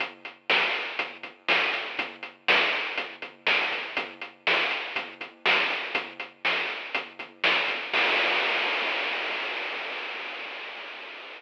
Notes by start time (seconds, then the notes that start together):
0.00 kick, closed hi-hat
0.25 closed hi-hat
0.50 snare
0.74 closed hi-hat
0.99 kick, closed hi-hat
1.23 kick, closed hi-hat
1.48 snare
1.73 kick, closed hi-hat
1.99 kick, closed hi-hat
2.23 closed hi-hat
2.48 snare
2.73 closed hi-hat
2.98 kick, closed hi-hat
3.22 kick, closed hi-hat
3.47 snare
3.72 kick, closed hi-hat
3.97 kick, closed hi-hat
4.21 closed hi-hat
4.47 snare
4.71 closed hi-hat
4.96 kick, closed hi-hat
5.21 kick, closed hi-hat
5.46 snare
5.70 kick, closed hi-hat
5.95 kick, closed hi-hat
6.20 closed hi-hat
6.45 snare
6.70 closed hi-hat
6.95 kick, closed hi-hat
7.19 kick, closed hi-hat
7.44 snare
7.68 kick, closed hi-hat
7.93 kick, crash